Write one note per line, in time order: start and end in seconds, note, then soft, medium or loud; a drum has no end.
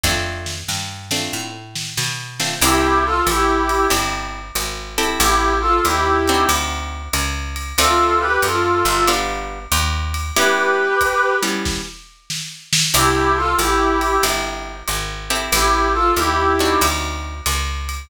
0.03 0.64 F2 loud
0.03 0.55 A3 medium
0.03 0.55 C4 medium
0.03 0.55 D4 medium
0.03 0.55 F4 medium
0.03 kick medium
0.03 snare medium
0.46 snare medium
0.68 1.28 G2 medium
0.68 snare medium
1.11 1.50 A3 medium
1.11 1.50 C4 medium
1.11 1.50 D4 medium
1.11 1.50 F4 medium
1.11 snare medium
1.33 1.93 A2 medium
1.76 snare medium
1.97 2.58 B2 medium
1.97 snare medium
2.40 2.55 A3 medium
2.40 2.55 C4 medium
2.40 2.55 D4 medium
2.40 2.55 F4 medium
2.40 snare medium
2.61 3.22 C2 loud
2.61 3.13 C4 loud
2.61 3.13 D4 medium
2.61 3.13 E4 loud
2.61 2.99 E4 loud
2.61 3.13 G4 loud
2.61 2.99 G4 loud
2.61 crash medium
2.61 ride medium
3.04 3.22 F4 loud
3.04 3.22 A4 loud
3.27 3.87 A1 loud
3.27 3.86 E4 medium
3.27 3.86 G4 loud
3.27 hi-hat pedal medium
3.27 ride medium
3.69 ride medium
3.90 4.51 G1 medium
3.90 4.42 C4 medium
3.90 4.42 D4 medium
3.90 4.42 E4 medium
3.90 4.42 G4 medium
3.90 ride medium
4.55 5.15 G#1 medium
4.55 hi-hat pedal medium
4.55 ride medium
4.98 5.71 C4 loud
4.98 5.71 E4 medium
4.98 5.71 G4 medium
4.98 5.71 A4 loud
4.98 ride medium
5.19 5.80 A1 loud
5.19 5.53 E4 medium
5.19 5.53 G4 loud
5.19 ride medium
5.61 5.80 F4 medium
5.61 5.80 A4 loud
5.84 6.45 D#2 medium
5.84 6.48 E4 medium
5.84 6.48 G4 loud
5.84 hi-hat pedal medium
5.84 ride medium
6.28 7.02 C4 medium
6.28 7.02 D4 medium
6.28 7.02 D#4 loud
6.28 7.02 F#4 loud
6.28 ride medium
6.49 7.09 D2 loud
6.49 ride loud
7.13 7.73 C#2 medium
7.13 hi-hat pedal medium
7.13 ride medium
7.56 ride medium
7.78 8.38 D2 medium
7.78 8.30 A3 loud
7.78 8.30 C4 loud
7.78 8.30 D4 loud
7.78 8.30 F4 loud
7.78 8.19 F4 loud
7.78 8.19 A4 loud
7.78 ride medium
8.20 8.40 G4 medium
8.20 8.40 B4 loud
8.42 8.83 F#2 medium
8.42 9.04 F4 medium
8.42 9.04 A4 loud
8.42 hi-hat pedal medium
8.42 ride medium
8.85 9.67 G1 loud
8.85 ride medium
9.08 9.59 G3 loud
9.08 9.59 B3 loud
9.08 9.59 D4 loud
9.08 9.59 F4 loud
9.08 ride medium
9.72 10.32 D#2 loud
9.72 hi-hat pedal medium
9.72 ride medium
10.14 ride medium
10.36 10.88 G3 loud
10.36 10.88 B3 medium
10.36 10.88 C#4 loud
10.36 10.88 E4 loud
10.36 11.34 G4 medium
10.36 11.34 B4 loud
10.36 ride medium
11.01 kick medium
11.01 hi-hat pedal medium
11.01 ride medium
11.43 11.82 G3 medium
11.43 11.82 B3 medium
11.43 11.82 C#4 medium
11.43 11.82 E4 medium
11.43 ride medium
11.65 kick medium
11.65 snare medium
12.30 snare medium
12.73 snare loud
12.94 13.54 C2 loud
12.94 13.45 C4 loud
12.94 13.45 D4 medium
12.94 13.45 E4 loud
12.94 13.31 E4 loud
12.94 13.45 G4 loud
12.94 13.31 G4 loud
12.94 crash medium
12.94 ride medium
13.36 13.54 F4 loud
13.36 13.54 A4 loud
13.58 14.19 A1 loud
13.58 14.16 E4 medium
13.58 14.16 G4 loud
13.58 hi-hat pedal medium
13.58 ride medium
14.01 ride medium
14.23 14.83 G1 medium
14.23 14.75 C4 medium
14.23 14.75 D4 medium
14.23 14.75 E4 medium
14.23 14.75 G4 medium
14.23 ride medium
14.88 15.49 G#1 medium
14.88 hi-hat pedal medium
14.88 ride medium
15.30 16.04 C4 loud
15.30 16.04 E4 medium
15.30 16.04 G4 medium
15.30 16.04 A4 loud
15.30 ride medium
15.52 16.12 A1 loud
15.52 15.88 E4 medium
15.52 15.88 G4 loud
15.52 ride medium
15.93 16.13 F4 medium
15.93 16.13 A4 loud
16.16 16.76 D#2 medium
16.16 16.81 E4 medium
16.16 16.81 G4 loud
16.16 hi-hat pedal medium
16.16 ride medium
16.59 17.34 C4 medium
16.59 17.34 D4 medium
16.59 17.34 D#4 loud
16.59 17.34 F#4 loud
16.59 ride medium
16.81 17.41 D2 loud
16.81 ride loud
17.46 18.06 C#2 medium
17.46 hi-hat pedal medium
17.46 ride medium
17.89 ride medium